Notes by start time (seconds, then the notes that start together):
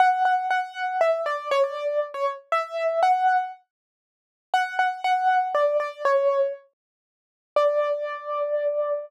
0.00 F#5
0.25 F#5
0.51 F#5
1.01 E5
1.26 D5
1.51 C#5
1.64 D5
2.14 C#5
2.52 E5
3.03 F#5
4.54 F#5
4.79 F#5
5.04 F#5
5.55 D5
5.80 D5
6.05 C#5
7.56 D5